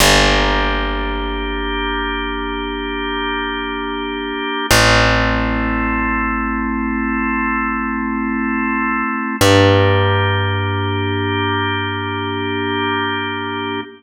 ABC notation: X:1
M:4/4
L:1/8
Q:1/4=51
K:Gdor
V:1 name="Drawbar Organ"
[B,DG]8 | [A,CE]8 | [B,DG]8 |]
V:2 name="Electric Bass (finger)" clef=bass
G,,,8 | A,,,8 | G,,8 |]